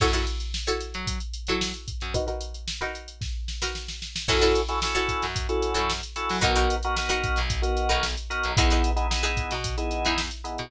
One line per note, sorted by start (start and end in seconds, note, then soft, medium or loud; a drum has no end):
0.00 0.25 F#2 medium
0.00 0.11 E4 medium
0.00 0.11 F#4 medium
0.00 0.11 A4 medium
0.00 0.11 C#5 medium
0.00 kick medium
0.00 crash medium
0.13 0.56 E4 medium
0.13 0.56 F#4 medium
0.13 0.56 A4 medium
0.13 0.56 C#5 medium
0.13 closed hi-hat medium
0.27 closed hi-hat medium
0.40 closed hi-hat medium
0.54 snare medium
0.67 1.10 E4 medium
0.67 1.10 F#4 medium
0.67 1.10 A4 medium
0.67 1.10 C#5 medium
0.67 closed hi-hat medium
0.80 closed hi-hat medium
0.94 1.19 F#3 medium
0.94 closed hi-hat medium
1.07 kick medium
1.07 closed hi-hat loud
1.20 closed hi-hat medium
1.33 closed hi-hat medium
1.47 1.72 F#3 medium
1.47 1.92 E4 medium
1.47 1.92 F#4 medium
1.47 1.92 A4 medium
1.47 1.92 C#5 medium
1.47 closed hi-hat medium
1.61 snare loud
1.74 closed hi-hat medium
1.88 kick medium
1.88 closed hi-hat medium
2.00 2.14 F#2 medium
2.00 snare soft
2.00 closed hi-hat medium
2.14 2.25 D#4 medium
2.14 2.25 F#4 medium
2.14 2.25 A#4 medium
2.14 2.25 B4 medium
2.14 kick medium
2.14 closed hi-hat medium
2.27 2.70 D#4 medium
2.27 2.70 F#4 medium
2.27 2.70 A#4 medium
2.27 2.70 B4 medium
2.27 closed hi-hat medium
2.41 closed hi-hat medium
2.54 closed hi-hat medium
2.68 snare medium
2.81 3.24 D#4 medium
2.81 3.24 F#4 medium
2.81 3.24 A#4 medium
2.81 3.24 B4 medium
2.81 closed hi-hat medium
2.95 closed hi-hat medium
3.08 closed hi-hat medium
3.21 kick medium
3.21 snare medium
3.48 snare medium
3.62 4.05 D#4 medium
3.62 4.05 F#4 medium
3.62 4.05 A#4 medium
3.62 4.05 B4 medium
3.62 snare medium
3.75 snare medium
3.88 snare medium
4.02 snare medium
4.16 snare medium
4.28 4.54 F#2 medium
4.28 4.61 C#4 medium
4.28 4.61 E4 medium
4.28 4.39 E4 medium
4.28 4.61 F#4 loud
4.28 4.39 F#4 loud
4.28 4.39 A4 medium
4.28 4.61 A4 loud
4.28 4.39 C#5 loud
4.28 kick medium
4.28 crash medium
4.41 4.84 E4 medium
4.41 4.84 F#4 medium
4.41 4.84 A4 medium
4.41 4.84 C#5 medium
4.41 closed hi-hat medium
4.55 closed hi-hat medium
4.68 4.79 C#4 medium
4.68 4.79 E4 medium
4.68 4.79 F#4 medium
4.68 4.79 A4 medium
4.68 closed hi-hat medium
4.82 5.25 C#4 medium
4.82 5.25 E4 medium
4.82 5.25 F#4 medium
4.82 5.25 A4 medium
4.82 snare loud
4.95 5.38 E4 medium
4.95 5.38 F#4 medium
4.95 5.38 A4 medium
4.95 5.38 C#5 medium
4.95 snare soft
4.95 closed hi-hat medium
5.08 kick medium
5.08 closed hi-hat medium
5.22 5.47 F#2 medium
5.22 snare medium
5.22 closed hi-hat medium
5.36 kick medium
5.36 closed hi-hat medium
5.49 5.92 C#4 medium
5.49 5.92 E4 medium
5.49 5.92 F#4 medium
5.49 5.92 A4 medium
5.49 closed hi-hat medium
5.62 closed hi-hat medium
5.74 6.01 F#2 medium
5.74 6.17 E4 medium
5.74 6.17 F#4 medium
5.74 6.17 A4 medium
5.74 6.17 C#5 medium
5.74 closed hi-hat medium
5.90 snare medium
6.03 closed hi-hat medium
6.16 6.37 C#4 medium
6.16 6.37 E4 medium
6.16 6.37 F#4 medium
6.16 6.37 A4 medium
6.16 snare soft
6.16 closed hi-hat medium
6.29 6.43 F#3 medium
6.29 open hi-hat medium
6.41 6.68 B1 medium
6.41 6.75 B3 loud
6.41 6.52 D#4 loud
6.41 6.75 D#4 medium
6.41 6.52 F#4 loud
6.41 6.75 F#4 medium
6.41 6.52 A#4 medium
6.41 6.75 A#4 loud
6.41 6.52 B4 medium
6.41 kick medium
6.41 closed hi-hat medium
6.55 6.98 D#4 medium
6.55 6.98 F#4 medium
6.55 6.98 A#4 medium
6.55 6.98 B4 medium
6.55 snare soft
6.55 closed hi-hat medium
6.70 closed hi-hat medium
6.83 6.95 B3 medium
6.83 6.95 D#4 medium
6.83 6.95 F#4 loud
6.83 6.95 A#4 medium
6.83 closed hi-hat medium
6.97 7.40 B3 medium
6.97 7.40 D#4 medium
6.97 7.40 F#4 medium
6.97 7.40 A#4 medium
6.97 snare medium
7.09 7.52 D#4 medium
7.09 7.52 F#4 loud
7.09 7.52 A#4 medium
7.09 7.52 B4 medium
7.09 closed hi-hat medium
7.24 kick medium
7.24 closed hi-hat medium
7.36 7.62 B1 medium
7.36 snare medium
7.36 closed hi-hat medium
7.50 kick medium
7.50 closed hi-hat medium
7.62 8.05 B3 medium
7.62 8.05 D#4 medium
7.62 8.05 F#4 medium
7.62 8.05 A#4 medium
7.62 closed hi-hat medium
7.77 closed hi-hat medium
7.89 8.15 B1 medium
7.89 8.32 D#4 medium
7.89 8.32 F#4 medium
7.89 8.32 A#4 medium
7.89 8.32 B4 medium
7.89 closed hi-hat medium
8.03 snare medium
8.17 closed hi-hat medium
8.30 8.51 B3 medium
8.30 8.51 D#4 medium
8.30 8.51 F#4 medium
8.30 8.51 A#4 medium
8.30 closed hi-hat medium
8.44 8.57 B1 medium
8.44 closed hi-hat medium
8.57 8.82 E2 medium
8.57 8.90 B3 loud
8.57 8.90 D#4 medium
8.57 8.68 D#4 loud
8.57 8.90 E4 loud
8.57 8.68 E4 medium
8.57 8.68 G#4 loud
8.57 8.90 G#4 medium
8.57 8.68 B4 medium
8.57 kick loud
8.57 closed hi-hat loud
8.70 9.14 D#4 medium
8.70 9.14 E4 medium
8.70 9.14 G#4 medium
8.70 9.14 B4 medium
8.70 snare soft
8.70 closed hi-hat medium
8.84 closed hi-hat medium
8.96 9.07 B3 medium
8.96 9.07 D#4 medium
8.96 9.07 E4 medium
8.96 9.07 G#4 medium
8.96 closed hi-hat medium
9.10 9.53 B3 medium
9.10 9.53 D#4 medium
9.10 9.53 E4 medium
9.10 9.53 G#4 medium
9.10 snare loud
9.23 9.66 D#4 medium
9.23 9.66 E4 medium
9.23 9.66 G#4 medium
9.23 9.66 B4 medium
9.23 closed hi-hat medium
9.37 kick medium
9.37 closed hi-hat medium
9.51 9.76 B2 medium
9.51 snare medium
9.51 closed hi-hat medium
9.64 kick medium
9.64 closed hi-hat medium
9.77 10.20 B3 medium
9.77 10.20 D#4 medium
9.77 10.20 E4 medium
9.77 10.20 G#4 medium
9.77 closed hi-hat medium
9.91 closed hi-hat medium
10.05 10.30 E2 medium
10.05 10.48 D#4 medium
10.05 10.48 E4 medium
10.05 10.48 G#4 medium
10.05 10.48 B4 medium
10.05 closed hi-hat medium
10.18 snare medium
10.31 closed hi-hat medium
10.44 10.65 B3 medium
10.44 10.65 D#4 medium
10.44 10.65 E4 medium
10.44 10.65 G#4 medium
10.44 closed hi-hat medium
10.58 10.71 B2 medium
10.58 closed hi-hat medium